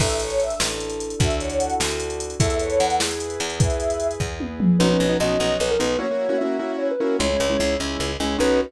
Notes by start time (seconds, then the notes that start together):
0.00 A1 D4 E4 A4 E5, kick, crash
0.10 closed hi-hat
0.20 C#5, closed hi-hat
0.30 closed hi-hat
0.40 E5, closed hi-hat
0.50 closed hi-hat
0.60 A1, snare
0.70 closed hi-hat
0.80 closed hi-hat
0.90 closed hi-hat
1.00 closed hi-hat
1.10 closed hi-hat
1.19 D2 D4 E4 F#4 A4 E5, kick, closed hi-hat
1.30 closed hi-hat
1.40 C#5, closed hi-hat
1.50 closed hi-hat
1.58 F#5, closed hi-hat
1.70 closed hi-hat
1.80 D2, snare
1.90 closed hi-hat
2.00 closed hi-hat
2.10 closed hi-hat
2.20 closed hi-hat
2.30 closed hi-hat
2.39 E2 E4 A4 B4 E5, kick, closed hi-hat
2.50 closed hi-hat
2.59 C#5, closed hi-hat
2.70 closed hi-hat
2.79 E2 F#5, closed hi-hat
2.90 closed hi-hat
3.00 E4 G#4 B4, snare
3.11 closed hi-hat
3.20 closed hi-hat
3.30 closed hi-hat
3.40 E2, closed hi-hat
3.50 closed hi-hat
3.59 E4 G#4 B4 E5, kick, closed hi-hat
3.70 closed hi-hat
3.80 closed hi-hat
3.90 closed hi-hat
4.00 closed hi-hat
4.11 closed hi-hat
4.20 E2, kick
4.40 high tom
4.60 mid tom
4.79 B1 B3 C#4 D#4 F#4 B4
4.90 B3 C#4 D#4 F#4
5.00 B1
5.09 B3 C#4 D#4 F#4
5.20 B1 B3 C#4 D#4 F#4 D#5
5.40 B1 B3 C#4 D#4 F#4
5.60 B1 B4
5.71 A#4
5.79 B1 B3 C#4 D#4 F#4 B4
5.99 A#3 C#4 E4 F#4 C#5
6.11 A#3 C#4 E4 F#4
6.29 A#3 C#4 E4 F#4
6.38 A#3 C#4 E4 F#4 E5
6.59 A#3 C#4 E4 F#4
6.78 C#5
6.91 B4
7.00 A#3 C#4 E4 F#4 A#4
7.19 C#2 G#3 C#4 E4 C#5
7.30 G#3 C#4 E4
7.40 C#2
7.50 G#3 C#4 E4
7.59 C#2 G#3 C#4 E4
7.80 C#2 G#3 C#4 E4
8.00 C#2
8.20 C#2 G#3 C#4 E4
8.38 B1 B3 C#4 D#4 F#4 B4